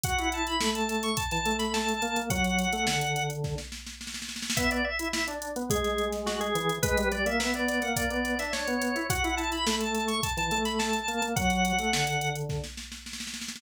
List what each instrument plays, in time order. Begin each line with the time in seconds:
0.04 drawbar organ F#4 F#5, kick, closed hi-hat
0.18 drawbar organ E4, closed hi-hat
0.32 drawbar organ A5, closed hi-hat
0.47 drawbar organ B5, closed hi-hat
0.61 drawbar organ A3, snare
0.75 drawbar organ A5, closed hi-hat
0.89 drawbar organ A5, snare, closed hi-hat
1.03 drawbar organ C#6, closed hi-hat
1.17 drawbar organ A5, kick, closed hi-hat
1.31 drawbar organ E3 A5, snare, closed hi-hat
1.46 drawbar organ A3, closed hi-hat
1.59 drawbar organ B5, snare, closed hi-hat
1.74 drawbar organ A5, snare
1.89 closed hi-hat
2.02 drawbar organ A#3, closed hi-hat
2.16 drawbar organ A#3, closed hi-hat
2.30 drawbar organ F#3 F#5, kick, closed hi-hat
2.44 closed hi-hat
2.59 closed hi-hat
2.73 drawbar organ A3, closed hi-hat
2.87 drawbar organ D3, snare
3.01 closed hi-hat
3.16 closed hi-hat
3.30 closed hi-hat
3.44 kick, snare
3.58 snare
3.72 snare
3.87 snare
4.01 snare
4.07 snare
4.14 snare
4.22 snare
4.29 snare
4.36 snare
4.42 snare
4.50 snare
4.57 drawbar organ B3 E5, kick, closed hi-hat
4.71 drawbar organ D5, closed hi-hat
4.85 drawbar organ E5
4.99 drawbar organ E4, closed hi-hat
5.13 drawbar organ E5, snare
5.28 drawbar organ D4, closed hi-hat
5.42 closed hi-hat
5.56 drawbar organ B3, closed hi-hat
5.70 drawbar organ G#3 G#4, kick, closed hi-hat
5.84 snare, closed hi-hat
5.98 closed hi-hat
6.13 snare, closed hi-hat
6.26 drawbar organ F#4, snare
6.40 drawbar organ G#4, closed hi-hat
6.55 drawbar organ E3, closed hi-hat
6.69 closed hi-hat
6.83 drawbar organ G#3 B4, kick, closed hi-hat
6.98 drawbar organ G3, closed hi-hat
7.12 drawbar organ G3 D5, closed hi-hat
7.26 drawbar organ A#3 E5, closed hi-hat
7.40 drawbar organ B3, snare
7.54 drawbar organ B3 D5, closed hi-hat
7.69 drawbar organ D5, snare, closed hi-hat
7.82 drawbar organ A#3 F#5, closed hi-hat
7.96 drawbar organ D5, kick, closed hi-hat
8.10 drawbar organ B3 D5, closed hi-hat
8.25 closed hi-hat
8.39 drawbar organ D4 E5, snare, closed hi-hat
8.53 drawbar organ C#5, snare
8.67 drawbar organ B3, closed hi-hat
8.82 closed hi-hat
8.96 drawbar organ E4, closed hi-hat
9.10 drawbar organ F#4 F#5, kick, closed hi-hat
9.24 drawbar organ E4, closed hi-hat
9.37 drawbar organ A5, closed hi-hat
9.52 drawbar organ B5, closed hi-hat
9.67 drawbar organ A3, snare
9.81 drawbar organ A5, closed hi-hat
9.94 drawbar organ A5, snare, closed hi-hat
10.08 drawbar organ C#6, closed hi-hat
10.23 drawbar organ A5, kick, closed hi-hat
10.37 drawbar organ E3 A5, snare, closed hi-hat
10.51 drawbar organ A3, closed hi-hat
10.65 drawbar organ B5, snare, closed hi-hat
10.79 drawbar organ A5, snare
10.93 closed hi-hat
11.08 drawbar organ A#3, closed hi-hat
11.22 drawbar organ A#3, closed hi-hat
11.36 drawbar organ F#3 F#5, kick, closed hi-hat
11.50 closed hi-hat
11.65 closed hi-hat
11.79 drawbar organ A3, closed hi-hat
11.93 drawbar organ D3, snare
12.07 closed hi-hat
12.21 closed hi-hat
12.36 closed hi-hat
12.49 kick, snare
12.64 snare
12.77 snare
12.92 snare
13.06 snare
13.13 snare
13.20 snare
13.27 snare
13.34 snare
13.42 snare
13.48 snare
13.56 snare